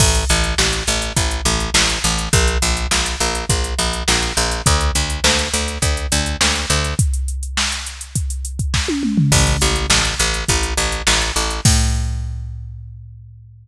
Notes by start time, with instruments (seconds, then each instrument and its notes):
0.00 electric bass (finger) A1, kick, crash
0.15 closed hi-hat
0.29 electric bass (finger) A1, closed hi-hat
0.44 closed hi-hat
0.58 electric bass (finger) A1, snare
0.73 closed hi-hat
0.87 electric bass (finger) A1, closed hi-hat
1.02 closed hi-hat
1.16 electric bass (finger) A1, kick, closed hi-hat
1.31 closed hi-hat
1.45 electric bass (finger) A1, closed hi-hat
1.60 closed hi-hat
1.74 electric bass (finger) A1, snare
1.89 closed hi-hat
2.04 electric bass (finger) A1, closed hi-hat
2.18 closed hi-hat
2.33 electric bass (finger) A#1, kick, closed hi-hat
2.48 closed hi-hat
2.62 electric bass (finger) A#1, closed hi-hat
2.77 closed hi-hat
2.91 electric bass (finger) A#1, snare
3.06 closed hi-hat
3.20 electric bass (finger) A#1, closed hi-hat
3.35 closed hi-hat
3.49 electric bass (finger) A#1, kick, closed hi-hat
3.64 closed hi-hat
3.79 electric bass (finger) A#1, closed hi-hat
3.93 closed hi-hat
4.08 electric bass (finger) A#1, snare
4.22 closed hi-hat
4.37 electric bass (finger) A#1, closed hi-hat
4.51 closed hi-hat
4.66 electric bass (finger) D2, kick, closed hi-hat
4.81 closed hi-hat
4.95 electric bass (finger) D2, closed hi-hat
5.10 closed hi-hat
5.24 electric bass (finger) D2, snare
5.39 closed hi-hat
5.54 electric bass (finger) D2, closed hi-hat
5.68 closed hi-hat
5.82 electric bass (finger) D2, kick, closed hi-hat
5.97 closed hi-hat
6.12 electric bass (finger) D2, closed hi-hat
6.26 closed hi-hat
6.41 electric bass (finger) D2, snare
6.55 closed hi-hat
6.70 electric bass (finger) D2, closed hi-hat
6.84 closed hi-hat
6.99 kick, closed hi-hat
7.14 closed hi-hat
7.28 closed hi-hat
7.43 closed hi-hat
7.57 snare
7.72 closed hi-hat
7.86 closed hi-hat
8.01 closed hi-hat
8.15 kick, closed hi-hat
8.30 closed hi-hat
8.45 closed hi-hat
8.59 kick, closed hi-hat
8.74 kick, snare
8.88 high tom
9.03 mid tom
9.17 floor tom
9.32 electric bass (finger) A1, kick, crash
9.47 closed hi-hat
9.61 electric bass (finger) A1, closed hi-hat
9.76 closed hi-hat
9.90 electric bass (finger) A1, snare
10.05 closed hi-hat
10.19 electric bass (finger) A1, closed hi-hat
10.34 closed hi-hat
10.48 electric bass (finger) A1, kick, closed hi-hat
10.63 closed hi-hat
10.77 electric bass (finger) A1, closed hi-hat
10.92 closed hi-hat
11.07 electric bass (finger) A1, snare
11.21 closed hi-hat
11.36 electric bass (finger) A1, closed hi-hat
11.50 closed hi-hat
11.65 electric bass (finger) A2, kick, crash